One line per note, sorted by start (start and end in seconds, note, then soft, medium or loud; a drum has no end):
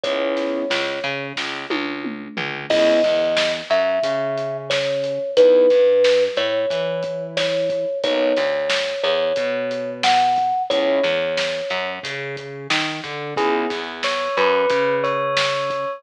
0.03 0.61 C#2 medium
0.03 0.64 G#3 medium
0.03 0.64 B3 medium
0.03 0.64 C#4 loud
0.03 0.64 E4 medium
0.03 1.24 C#5 medium
0.03 kick medium
0.03 closed hi-hat medium
0.37 snare soft
0.37 closed hi-hat medium
0.70 0.99 C#2 medium
0.70 0.99 C#3 medium
0.70 snare medium
1.04 1.33 C#3 medium
1.04 1.33 C#4 medium
1.04 closed hi-hat medium
1.36 1.66 C#2 medium
1.36 1.66 C#3 medium
1.36 kick medium
1.36 snare medium
1.70 2.28 C#2 medium
1.70 2.28 C#3 medium
1.70 high tom medium
2.04 mid tom medium
2.37 2.66 C#2 medium
2.37 2.66 C#3 medium
2.37 floor tom medium
2.70 2.99 C#2 medium
2.70 3.01 G#3 loud
2.70 3.01 B3 loud
2.70 3.01 C#4 loud
2.70 3.01 E4 loud
2.70 3.53 D#5 medium
2.70 kick medium
2.70 crash medium
3.03 3.62 E2 medium
3.03 3.61 E3 medium
3.03 kick medium
3.03 snare soft
3.03 closed hi-hat medium
3.37 snare loud
3.70 3.99 F#2 medium
3.70 3.99 F#3 medium
3.70 4.57 E5 medium
3.70 closed hi-hat medium
4.03 5.18 C#3 medium
4.03 5.18 C#4 medium
4.03 kick medium
4.03 closed hi-hat medium
4.38 closed hi-hat medium
4.70 5.31 C#5 medium
4.70 snare medium
5.04 closed hi-hat medium
5.37 5.66 E2 medium
5.37 5.67 G#3 medium
5.37 5.67 B3 medium
5.37 5.67 D#4 loud
5.37 5.67 E4 medium
5.37 6.23 B4 medium
5.37 kick medium
5.37 closed hi-hat medium
5.70 6.28 G2 medium
5.70 6.28 G3 medium
5.70 kick medium
5.70 snare soft
5.70 closed hi-hat medium
6.04 snare medium
6.36 6.66 A2 medium
6.36 6.66 A3 medium
6.36 7.23 C#5 medium
6.36 closed hi-hat medium
6.70 7.85 E3 medium
6.70 7.85 E4 medium
6.70 kick medium
6.70 closed hi-hat medium
7.03 kick medium
7.03 closed hi-hat medium
7.37 7.98 C#5 medium
7.37 snare medium
7.70 kick medium
7.70 closed hi-hat medium
8.03 8.33 B1 medium
8.03 8.34 F#3 medium
8.03 8.34 A#3 loud
8.03 8.34 B3 loud
8.03 8.34 D#4 loud
8.03 9.02 C#5 medium
8.03 kick medium
8.03 closed hi-hat medium
8.36 8.95 D2 medium
8.36 8.95 D3 soft
8.36 snare soft
8.36 closed hi-hat medium
8.69 snare loud
9.03 9.33 E2 medium
9.03 9.32 E3 medium
9.03 9.90 C#5 medium
9.03 closed hi-hat medium
9.36 10.52 B2 medium
9.36 10.52 B3 medium
9.36 kick medium
9.36 closed hi-hat medium
9.71 closed hi-hat medium
10.03 10.63 F#5 medium
10.03 snare loud
10.36 kick medium
10.36 closed hi-hat medium
10.70 10.99 C#2 medium
10.70 11.01 G#3 loud
10.70 11.01 B3 loud
10.70 11.01 C#4 loud
10.70 11.01 E4 loud
10.70 11.90 C#5 medium
10.70 kick medium
10.70 closed hi-hat medium
11.03 11.61 E2 medium
11.03 11.61 E3 medium
11.03 snare soft
11.03 closed hi-hat medium
11.37 snare medium
11.70 11.99 F#2 medium
11.70 11.99 F#3 medium
11.70 closed hi-hat medium
12.03 12.67 C#3 medium
12.03 12.67 C#4 medium
12.03 kick medium
12.03 closed hi-hat medium
12.37 kick medium
12.37 closed hi-hat medium
12.70 13.00 D#3 medium
12.70 13.01 D#4 medium
12.70 snare loud
13.04 13.34 D3 medium
13.04 13.34 D4 medium
13.04 kick medium
13.04 closed hi-hat medium
13.36 13.66 C#2 medium
13.36 13.67 B3 loud
13.36 13.67 C#4 medium
13.36 13.67 E4 loud
13.36 13.67 G#4 medium
13.36 13.55 G#4 medium
13.36 kick loud
13.36 closed hi-hat medium
13.70 14.28 E2 medium
13.70 14.28 E3 medium
13.70 kick medium
13.70 snare medium
13.70 closed hi-hat medium
14.03 14.36 C#5 medium
14.03 snare medium
14.37 14.66 F#2 medium
14.37 14.66 F#3 medium
14.37 14.94 B4 medium
14.37 closed hi-hat medium
14.69 15.85 C#3 medium
14.69 15.85 C#4 medium
14.69 kick medium
14.69 closed hi-hat medium
15.03 15.92 C#5 medium
15.03 closed hi-hat medium
15.37 snare loud
15.70 kick medium
15.70 closed hi-hat medium